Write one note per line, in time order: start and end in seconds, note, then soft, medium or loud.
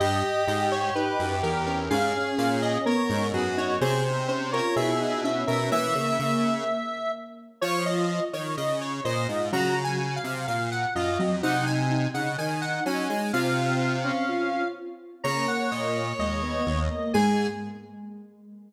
0.00 0.23 G2 loud
0.00 0.40 G4 medium
0.00 1.78 G4 medium
0.00 0.45 D#5 medium
0.47 0.90 G#2 loud
0.47 0.90 G4 medium
0.47 0.70 D#5 medium
0.72 0.94 C#5 medium
0.95 1.18 D#4 medium
0.95 1.36 B4 medium
1.19 1.42 F#2 loud
1.43 1.89 E2 loud
1.43 1.65 A#4 medium
1.66 1.89 C#4 medium
1.66 1.89 A#4 medium
1.90 2.13 G#2 loud
1.90 2.83 C#4 medium
1.90 2.78 G#4 medium
1.90 2.29 F5 medium
2.38 2.78 A#2 loud
2.38 2.61 F5 medium
2.62 2.85 D#5 medium
2.86 3.08 B3 medium
2.86 3.27 A#4 medium
2.86 3.27 C#5 medium
3.10 3.32 G#2 loud
3.10 3.32 D#4 medium
3.33 3.79 F#2 medium
3.33 3.56 B3 medium
3.33 3.76 F#4 medium
3.33 3.56 G#4 medium
3.57 3.80 D#4 medium
3.57 3.80 C#5 medium
3.81 4.61 C3 loud
3.81 4.23 C4 medium
3.81 4.04 G#4 medium
3.81 4.27 C5 medium
4.28 4.51 C#4 medium
4.28 4.51 C5 medium
4.52 4.75 F4 medium
4.52 4.75 A#4 medium
4.52 4.75 C#5 medium
4.76 5.44 B2 loud
4.76 4.99 E4 medium
4.76 5.20 G#4 medium
4.76 5.21 E5 medium
5.00 5.23 D#4 medium
5.24 5.69 C#4 medium
5.24 5.47 E5 medium
5.47 5.70 B2 medium
5.47 5.70 A#4 medium
5.47 5.70 E5 medium
5.71 5.94 E3 loud
5.71 6.62 A#3 medium
5.71 7.12 E5 medium
5.71 6.54 E5 medium
5.95 6.18 C#3 loud
6.19 6.64 C#3 loud
7.61 8.20 F3 loud
7.61 8.04 F4 medium
7.61 7.84 C#5 medium
7.61 7.85 C#5 medium
7.86 8.25 D#5 medium
8.33 8.56 D#3 medium
8.33 8.56 C#5 medium
8.57 9.01 C#3 loud
8.57 8.80 D#5 medium
8.81 9.04 C#5 medium
9.05 9.27 A#2 loud
9.05 9.27 C5 medium
9.05 9.49 D#5 medium
9.29 9.51 G#2 medium
9.29 9.51 F4 medium
9.52 10.19 C#3 loud
9.52 9.98 F#3 medium
9.52 9.75 F#4 medium
9.52 9.83 A#5 medium
9.84 10.14 G#5 medium
10.16 10.46 F5 medium
10.24 10.47 C3 loud
10.47 10.86 A#2 medium
10.47 10.70 F5 medium
10.71 10.94 F#5 medium
10.95 11.18 F#2 medium
10.95 11.18 F4 medium
10.95 11.36 D#5 medium
11.19 11.42 F2 medium
11.19 11.42 F#3 medium
11.43 12.08 C3 loud
11.43 11.65 D#4 medium
11.43 11.88 D#4 medium
11.43 11.65 F#5 medium
11.66 12.09 G#5 medium
11.90 12.34 D#4 medium
12.14 12.37 C#3 medium
12.14 12.37 F#5 medium
12.38 12.80 D#3 medium
12.38 13.05 D#4 medium
12.38 12.61 G#5 medium
12.62 12.84 F#5 medium
12.86 13.08 F#3 medium
12.86 13.09 C#4 medium
12.86 13.32 G#5 medium
13.10 13.32 G#3 medium
13.33 14.12 C3 loud
13.33 14.22 C4 medium
13.33 13.96 F4 medium
13.33 14.68 F5 medium
14.04 14.63 C#4 medium
14.29 14.70 F4 medium
15.24 15.47 C#3 loud
15.24 16.05 A#3 medium
15.24 16.79 C#5 medium
15.24 15.46 A#5 medium
15.48 15.70 F#5 medium
15.71 16.13 A#2 medium
15.71 16.13 D#5 medium
16.19 16.62 D#2 medium
16.19 16.41 G#3 medium
16.19 17.12 D#5 medium
16.43 16.65 B3 medium
16.67 16.89 D#2 medium
16.90 17.13 A#3 medium
17.13 17.48 G#2 loud
17.13 17.47 G#3 loud
17.13 17.47 G#4 loud
17.13 17.47 G#5 loud